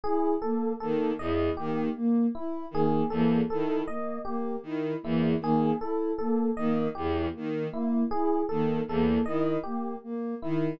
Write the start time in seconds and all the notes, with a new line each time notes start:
0.04 E4 G#4
0.42 A#3 A4
0.80 D#3 A#3 A4
1.19 E2 E4 D#5
1.57 D#3 A#3 G4
1.96 A#3
2.35 E4
2.71 D#3 A#3 G#4
3.10 E2 A#3 A4
3.50 D#3 E4 A4
3.88 A#3 D#5
4.25 A#3 G4
4.63 D#3 E4
5.03 E2 A#3 E4
5.40 D#3 A#3 G#4
5.80 E4 A4
6.18 A#3 A4
6.57 D#3 A#3 D#5
6.95 E2 E4 G4
7.34 D#3 A#3
7.72 A#3 E4
8.11 E4 G#4
8.49 D#3 A#3 A4
8.87 E2 A#3 A4
9.26 D#3 E4 D#5
9.63 A#3 G4
10.04 A#3
10.42 D#3 E4